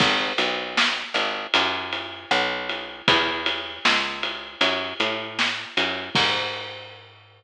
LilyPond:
<<
  \new Staff \with { instrumentName = "Electric Bass (finger)" } { \clef bass \time 4/4 \key gis \minor \tempo 4 = 78 gis,,8 b,,4 gis,,8 fis,4 b,,4 | e,4 cis,4 fis,8 a,4 fis,8 | gis,1 | }
  \new DrumStaff \with { instrumentName = "Drums" } \drummode { \time 4/4 <cymc bd>8 cymr8 sn8 cymr8 cymr8 cymr8 ss8 cymr8 | <bd cymr>8 cymr8 sn8 cymr8 cymr8 cymr8 sn8 cymr8 | <cymc bd>4 r4 r4 r4 | }
>>